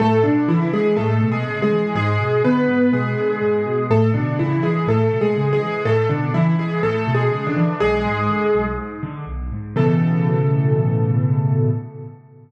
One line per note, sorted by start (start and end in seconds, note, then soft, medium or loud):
0.00 0.23 A2 loud
0.00 0.23 A3 loud
0.00 0.23 A4 loud
0.24 0.47 B2 medium
0.24 0.46 D3 loud
0.24 0.46 D4 loud
0.48 0.70 C#3 medium
0.48 0.71 E3 loud
0.48 0.71 E4 loud
0.73 0.96 E3 medium
0.73 0.97 G#3 loud
0.73 0.97 G#4 loud
0.97 1.19 A2 medium
0.97 1.27 A3 medium
0.97 1.27 A4 loud
1.21 1.43 B2 medium
1.32 1.62 G#3 loud
1.32 1.62 G#4 loud
1.47 1.69 C#3 medium
1.62 1.94 G#3 medium
1.62 1.94 G#4 loud
1.71 1.93 E3 medium
1.95 2.17 G#2 loud
1.95 2.42 G#3 loud
1.95 2.42 G#4 loud
2.20 2.42 B2 medium
2.44 2.66 D3 medium
2.44 2.91 B3 loud
2.44 2.91 B4 loud
2.68 2.90 G#2 medium
2.92 3.14 B2 medium
2.92 3.85 G#3 medium
2.92 3.85 G#4 loud
3.17 3.39 D3 medium
3.41 3.63 G#2 medium
3.66 3.88 B2 medium
3.90 4.12 A2 medium
3.90 4.10 A3 loud
3.90 4.10 A4 loud
4.14 4.37 B2 medium
4.14 4.37 D3 medium
4.14 4.37 D4 loud
4.39 4.61 C#3 medium
4.39 4.63 E3 medium
4.39 4.63 E4 loud
4.63 4.85 E3 medium
4.63 4.87 G#3 medium
4.63 4.87 G#4 medium
4.87 5.09 A2 medium
4.87 5.19 A3 medium
4.87 5.19 A4 loud
5.12 5.34 B2 medium
5.21 5.49 G#3 medium
5.21 5.49 G#4 loud
5.36 5.58 C#3 medium
5.53 5.82 G#3 loud
5.53 5.82 G#4 loud
5.61 5.83 E3 medium
5.85 6.07 A2 medium
5.85 6.08 A3 loud
5.85 6.08 A4 loud
6.09 6.32 B2 medium
6.09 6.31 D3 medium
6.09 6.31 D4 medium
6.34 6.56 C#3 medium
6.34 6.55 E3 loud
6.34 6.55 E4 loud
6.58 6.80 E3 medium
6.58 6.80 G#3 medium
6.58 6.80 G#4 loud
6.83 7.05 A2 medium
6.83 7.12 A3 loud
6.83 7.12 A4 loud
7.07 7.29 B2 medium
7.15 7.45 G#3 medium
7.15 7.45 G#4 loud
7.32 7.54 C#3 medium
7.47 7.76 D3 medium
7.47 7.76 D4 loud
7.56 7.78 E3 medium
7.80 8.03 B1 medium
7.80 8.65 G#3 loud
7.80 8.65 G#4 loud
8.05 8.27 G#2 medium
8.29 8.51 D3 medium
8.54 8.76 B1 medium
8.78 9.00 G#2 medium
9.03 9.25 D3 medium
9.26 9.48 B1 medium
9.52 9.74 G#2 medium
9.76 11.70 A2 loud
9.76 11.70 B2 loud
9.76 11.70 C#3 loud
9.76 11.70 E3 loud
9.76 11.70 A4 loud